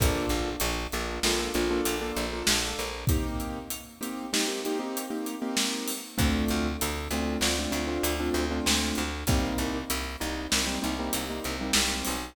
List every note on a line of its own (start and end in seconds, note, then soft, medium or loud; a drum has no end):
0.00 0.26 A#1 loud
0.00 0.49 A#3 loud
0.00 0.49 D4 loud
0.00 0.49 F4 loud
0.00 0.49 A4 loud
0.00 kick medium
0.00 closed hi-hat loud
0.29 0.56 A#1 loud
0.29 closed hi-hat medium
0.60 0.87 A#1 loud
0.60 closed hi-hat medium
0.92 1.20 A#1 loud
0.92 1.18 A#3 loud
0.92 1.18 D4 loud
0.92 1.18 F4 medium
0.92 1.18 A4 loud
0.92 closed hi-hat medium
1.23 1.49 A#1 loud
1.23 1.37 A#3 loud
1.23 1.37 D4 loud
1.23 1.37 F4 loud
1.23 1.37 A4 loud
1.23 snare loud
1.39 1.52 A#3 loud
1.39 1.52 D4 loud
1.39 1.52 F4 loud
1.39 1.52 A4 loud
1.54 1.81 A#1 medium
1.54 1.67 A#3 medium
1.54 1.67 D4 loud
1.54 1.67 F4 loud
1.54 1.67 A4 loud
1.54 closed hi-hat medium
1.71 1.95 A#3 loud
1.71 1.95 D4 loud
1.71 1.95 F4 loud
1.71 1.95 A4 loud
1.85 2.12 A#1 medium
1.85 closed hi-hat medium
2.01 2.26 A#3 loud
2.01 2.26 D4 loud
2.01 2.26 F4 loud
2.01 2.26 A4 loud
2.16 2.43 A#1 medium
2.16 closed hi-hat medium
2.33 2.83 A#3 loud
2.33 2.83 D4 medium
2.33 2.83 F4 medium
2.33 2.83 A4 loud
2.47 2.74 A#1 loud
2.47 snare loud
2.79 3.05 A#1 medium
2.79 closed hi-hat medium
3.07 3.59 A#3 loud
3.07 3.59 C4 loud
3.07 3.59 D#4 loud
3.07 3.59 G4 loud
3.07 kick loud
3.07 closed hi-hat medium
3.40 closed hi-hat medium
3.70 closed hi-hat medium
4.01 4.26 A#3 loud
4.01 4.26 C4 medium
4.01 4.26 D#4 loud
4.01 4.26 G4 loud
4.01 closed hi-hat medium
4.33 4.45 A#3 loud
4.33 4.45 C4 loud
4.33 4.45 D#4 loud
4.33 4.45 G4 loud
4.33 snare loud
4.48 4.60 A#3 loud
4.48 4.60 C4 loud
4.48 4.60 D#4 medium
4.48 4.60 G4 loud
4.65 4.78 A#3 loud
4.65 4.78 C4 loud
4.65 4.78 D#4 loud
4.65 4.78 G4 loud
4.65 closed hi-hat medium
4.79 5.04 A#3 medium
4.79 5.04 C4 loud
4.79 5.04 D#4 loud
4.79 5.04 G4 loud
4.97 closed hi-hat medium
5.10 5.35 A#3 loud
5.10 5.35 C4 medium
5.10 5.35 D#4 medium
5.10 5.35 G4 medium
5.26 closed hi-hat medium
5.42 5.91 A#3 loud
5.42 5.91 C4 loud
5.42 5.91 D#4 loud
5.42 5.91 G4 loud
5.57 snare loud
5.88 open hi-hat medium
6.18 6.45 D2 loud
6.18 6.67 A3 loud
6.18 6.67 C4 loud
6.18 6.67 D4 loud
6.18 6.67 F4 loud
6.18 kick medium
6.18 closed hi-hat medium
6.48 6.77 D2 loud
6.48 closed hi-hat medium
6.81 7.08 D2 loud
6.81 closed hi-hat loud
7.11 7.37 D2 medium
7.11 7.37 A3 loud
7.11 7.37 C4 loud
7.11 7.37 D4 medium
7.11 7.37 F4 medium
7.11 closed hi-hat medium
7.41 7.67 D2 loud
7.41 7.55 A3 loud
7.41 7.55 C4 loud
7.41 7.55 D4 loud
7.41 7.55 F4 loud
7.41 snare medium
7.59 7.71 A3 loud
7.59 7.71 C4 loud
7.59 7.71 D4 loud
7.59 7.71 F4 loud
7.72 7.98 D2 medium
7.72 7.84 A3 loud
7.72 7.84 C4 medium
7.72 7.84 D4 loud
7.72 7.84 F4 medium
7.72 closed hi-hat medium
7.87 8.12 A3 medium
7.87 8.12 C4 loud
7.87 8.12 D4 loud
7.87 8.12 F4 loud
8.03 8.30 D2 medium
8.03 closed hi-hat loud
8.20 8.44 A3 loud
8.20 8.44 C4 loud
8.20 8.44 D4 loud
8.20 8.44 F4 loud
8.34 8.60 D2 loud
8.34 closed hi-hat medium
8.51 9.01 A3 medium
8.51 9.01 C4 medium
8.51 9.01 D4 loud
8.51 9.01 F4 loud
8.66 8.93 D2 medium
8.66 snare loud
8.95 9.24 D2 loud
8.95 closed hi-hat medium
9.27 9.54 C2 loud
9.27 9.78 G3 loud
9.27 9.78 A#3 loud
9.27 9.78 C4 loud
9.27 9.78 D#4 loud
9.27 kick medium
9.27 closed hi-hat medium
9.58 9.85 C2 medium
9.58 closed hi-hat medium
9.90 10.16 C2 loud
9.90 closed hi-hat loud
10.20 10.47 C2 medium
10.20 10.45 G3 loud
10.20 10.45 A#3 medium
10.20 10.45 C4 medium
10.20 10.45 D#4 loud
10.20 closed hi-hat medium
10.51 10.78 C2 medium
10.51 10.64 G3 loud
10.51 10.64 A#3 loud
10.51 10.64 C4 loud
10.51 10.64 D#4 medium
10.51 snare loud
10.66 10.79 G3 loud
10.66 10.79 A#3 loud
10.66 10.79 C4 loud
10.66 10.79 D#4 medium
10.82 11.10 C2 medium
10.82 10.94 G3 loud
10.82 10.94 A#3 medium
10.82 10.94 C4 loud
10.82 10.94 D#4 loud
10.82 closed hi-hat medium
10.99 11.24 G3 loud
10.99 11.24 A#3 loud
10.99 11.24 C4 loud
10.99 11.24 D#4 medium
11.13 11.40 C2 medium
11.13 closed hi-hat loud
11.30 11.54 G3 medium
11.30 11.54 A#3 loud
11.30 11.54 C4 medium
11.30 11.54 D#4 loud
11.44 11.71 C2 medium
11.44 closed hi-hat medium
11.61 12.11 G3 loud
11.61 12.11 A#3 loud
11.61 12.11 C4 loud
11.61 12.11 D#4 medium
11.73 12.03 C2 loud
11.73 snare loud
12.05 12.35 B1 medium
12.05 open hi-hat medium